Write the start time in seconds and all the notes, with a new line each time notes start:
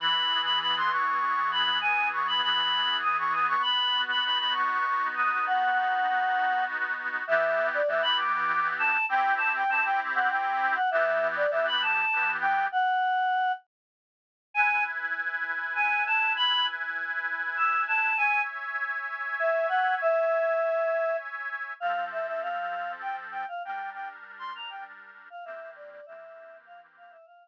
0.00 E3 B5
0.29 G#4
0.44 B5
0.60 B3 B5
0.77 C6
0.91 G#4 C#6
1.20 E3
1.52 G#4 B5
1.81 G#4 G#5
2.11 B3 C#6
2.28 B5
2.42 E3 B5
2.73 G#4
3.03 B3 D#6
3.19 C#6
3.33 B3 D#6
3.48 C#6
3.62 B5
3.94 F#4
4.10 B5
4.24 D#4 B5
4.39 B5
4.53 F#4 C#6
4.87 B3
5.15 F#4 D#6
5.45 F#4 F#5
5.76 D#4
6.07 B3
6.35 F#4
6.66 D#4
6.98 F#4
7.27 E3 B3 G4 E5
7.74 D5
7.88 E3 B3 G4 E5
8.03 B5
8.18 D6
8.79 A5
9.09 C4 E4 G4 G5
9.38 A5
9.56 G5
9.69 C4 E4 G4 A5
9.86 G5
10.15 F#5
10.30 G5
10.76 F#5
10.91 E3 B3 G4 E5
11.36 D5
11.50 E3 B3 G4 E5
11.67 B5
11.82 A5
12.13 E3 B3 G4
12.41 G5
12.72 F#5
14.54 E4 B4 G#5
15.75 G#5
16.07 A5
16.37 B5
17.57 E6
17.88 A5
18.17 C#5 E5 G#5
19.40 E5
19.69 F#5
20.02 E5
21.80 F3 C4 A4 F5
22.12 E5
22.27 E5
22.42 F5
23.02 G5
23.32 G5
23.48 F5
23.65 G3 D4 A#4 G5
23.94 G5
24.39 C6
24.55 A#5
24.70 G5
25.30 F5
25.45 E3 A#3 C4 G4 E5
25.76 D5
25.91 D5
26.06 E3 A#3 C4 G4 E5
26.66 F5
26.97 F5
27.11 E5
27.26 F5